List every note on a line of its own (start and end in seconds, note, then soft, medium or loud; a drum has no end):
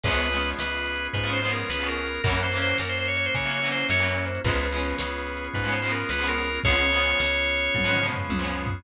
0.03 0.54 C#2 medium
0.03 0.26 F3 medium
0.03 0.26 G#3 medium
0.03 2.20 B3 medium
0.03 0.26 B3 medium
0.03 2.20 C#4 medium
0.03 2.20 F4 medium
0.03 2.20 G#4 medium
0.03 0.50 B4 medium
0.03 kick medium
0.03 crash medium
0.09 0.26 C#4 medium
0.14 closed hi-hat medium
0.24 closed hi-hat medium
0.32 0.61 F3 medium
0.32 0.61 G#3 medium
0.32 0.61 B3 medium
0.32 closed hi-hat medium
0.36 0.61 C#4 medium
0.41 closed hi-hat medium
0.51 closed hi-hat medium
0.59 1.09 C#2 medium
0.59 1.07 B4 medium
0.59 snare medium
0.69 closed hi-hat medium
0.77 closed hi-hat medium
0.86 closed hi-hat medium
0.96 closed hi-hat medium
1.05 closed hi-hat medium
1.13 1.64 G#2 medium
1.13 1.30 B4 medium
1.13 kick medium
1.13 closed hi-hat medium
1.23 1.38 F3 medium
1.23 1.38 G#3 medium
1.23 1.38 B3 medium
1.23 closed hi-hat medium
1.28 1.38 C#4 medium
1.32 1.41 C5 medium
1.32 closed hi-hat medium
1.42 1.71 F3 medium
1.42 1.71 G#3 medium
1.42 1.71 B3 medium
1.42 1.51 C5 medium
1.42 closed hi-hat medium
1.47 1.71 C#4 medium
1.47 closed hi-hat medium
1.52 1.69 A#4 medium
1.60 closed hi-hat medium
1.69 2.19 C#2 medium
1.69 1.87 B4 medium
1.69 snare medium
1.77 2.08 F3 medium
1.77 2.08 G#3 medium
1.77 closed hi-hat medium
1.82 2.08 B3 medium
1.82 2.08 C#4 medium
1.87 2.22 A#4 medium
1.87 closed hi-hat medium
1.97 closed hi-hat medium
2.06 closed hi-hat medium
2.15 closed hi-hat medium
2.24 2.74 F#2 medium
2.24 2.46 E3 medium
2.24 2.46 F#3 loud
2.24 4.40 A#3 medium
2.24 2.46 A#3 medium
2.24 4.40 C#4 medium
2.24 4.40 E4 medium
2.24 4.40 F#4 medium
2.24 2.40 A#4 medium
2.24 kick loud
2.24 closed hi-hat medium
2.29 2.46 C#4 medium
2.29 closed hi-hat medium
2.43 2.58 C5 medium
2.43 closed hi-hat medium
2.52 2.81 E3 medium
2.52 2.81 F#3 medium
2.52 2.81 A#3 medium
2.52 closed hi-hat medium
2.57 2.81 C#4 medium
2.61 2.77 C5 medium
2.61 closed hi-hat medium
2.70 closed hi-hat medium
2.78 3.29 F#2 medium
2.78 2.89 A#4 medium
2.78 snare medium
2.87 2.98 C5 medium
2.87 closed hi-hat medium
2.97 3.07 C5 medium
2.97 closed hi-hat medium
3.06 3.16 C#5 medium
3.06 closed hi-hat medium
3.16 3.25 C#5 medium
3.16 closed hi-hat medium
3.25 3.34 C5 medium
3.25 closed hi-hat medium
3.34 3.84 C#3 medium
3.34 3.68 C#5 medium
3.34 kick medium
3.34 closed hi-hat medium
3.44 3.58 E3 medium
3.44 3.58 F#3 medium
3.44 3.58 A#3 medium
3.44 closed hi-hat medium
3.48 3.58 C#4 medium
3.53 closed hi-hat medium
3.62 3.91 E3 medium
3.62 3.91 F#3 medium
3.62 3.91 A#3 medium
3.62 closed hi-hat medium
3.67 3.91 C#4 medium
3.71 3.87 C5 medium
3.71 closed hi-hat medium
3.80 closed hi-hat medium
3.89 4.39 F#2 medium
3.89 4.16 C#5 medium
3.89 snare medium
3.99 4.28 E3 medium
3.99 4.28 F#3 medium
3.99 4.28 A#3 medium
3.99 closed hi-hat medium
4.03 4.28 C#4 medium
4.08 closed hi-hat medium
4.17 4.26 C#5 medium
4.17 closed hi-hat medium
4.26 4.41 C5 medium
4.26 closed hi-hat medium
4.35 closed hi-hat medium
4.44 4.94 C#2 medium
4.44 4.67 F3 medium
4.44 4.67 G#3 medium
4.44 6.60 B3 medium
4.44 4.67 B3 medium
4.44 6.60 C#4 medium
4.44 6.60 F4 medium
4.44 6.60 G#4 medium
4.44 4.96 B4 medium
4.44 kick medium
4.44 closed hi-hat medium
4.49 4.67 C#4 medium
4.49 closed hi-hat medium
4.63 closed hi-hat medium
4.72 5.01 F3 medium
4.72 5.01 G#3 medium
4.72 5.01 B3 medium
4.72 closed hi-hat medium
4.77 5.01 C#4 medium
4.77 closed hi-hat medium
4.90 closed hi-hat medium
4.98 5.49 C#2 medium
4.98 5.47 B4 medium
4.98 snare loud
5.10 closed hi-hat medium
5.18 closed hi-hat medium
5.27 closed hi-hat medium
5.37 closed hi-hat medium
5.44 closed hi-hat medium
5.54 6.04 G#2 medium
5.54 5.71 B4 medium
5.54 kick medium
5.54 closed hi-hat medium
5.64 5.78 F3 medium
5.64 5.78 G#3 medium
5.64 5.78 B3 medium
5.64 closed hi-hat medium
5.69 5.78 C#4 medium
5.73 5.81 C5 medium
5.73 closed hi-hat medium
5.82 6.12 F3 medium
5.82 6.12 G#3 medium
5.82 6.12 B3 medium
5.82 5.91 C5 medium
5.82 closed hi-hat medium
5.87 6.12 C#4 medium
5.87 closed hi-hat medium
5.92 6.09 A#4 medium
6.01 closed hi-hat medium
6.09 6.59 C#2 medium
6.09 6.27 B4 medium
6.09 snare medium
6.18 6.48 F3 medium
6.18 6.48 G#3 medium
6.18 6.48 B3 medium
6.18 closed hi-hat medium
6.24 6.48 C#4 medium
6.28 6.59 A#4 medium
6.28 closed hi-hat medium
6.37 closed hi-hat medium
6.46 closed hi-hat medium
6.55 closed hi-hat medium
6.64 7.14 C#2 medium
6.64 6.87 F3 loud
6.64 6.87 G#3 medium
6.64 8.81 B3 medium
6.64 8.81 C#4 medium
6.64 8.81 F4 medium
6.64 8.81 G#4 medium
6.64 8.06 C#5 medium
6.64 kick medium
6.64 closed hi-hat medium
6.68 6.87 B3 medium
6.68 6.87 C#4 medium
6.73 closed hi-hat medium
6.83 closed hi-hat medium
6.92 7.22 F3 medium
6.92 7.22 G#3 medium
6.92 7.22 B3 medium
6.92 closed hi-hat medium
6.97 7.22 C#4 medium
6.97 closed hi-hat medium
7.12 closed hi-hat medium
7.20 7.69 C#2 medium
7.20 snare medium
7.28 closed hi-hat medium
7.40 closed hi-hat medium
7.46 closed hi-hat medium
7.57 closed hi-hat medium
7.66 closed hi-hat medium
7.74 8.24 G#2 medium
7.74 kick medium
7.74 high tom medium
7.84 7.99 F3 medium
7.84 7.99 G#3 medium
7.84 7.99 B3 medium
7.89 7.99 C#4 medium
7.93 mid tom medium
8.02 8.32 F3 medium
8.02 8.32 G#3 medium
8.02 8.32 B3 medium
8.07 8.32 C#4 medium
8.11 floor tom medium
8.29 8.80 C#2 medium
8.29 high tom medium
8.39 8.68 F3 medium
8.39 8.68 G#3 medium
8.39 8.68 B3 medium
8.44 8.68 C#4 medium
8.66 floor tom medium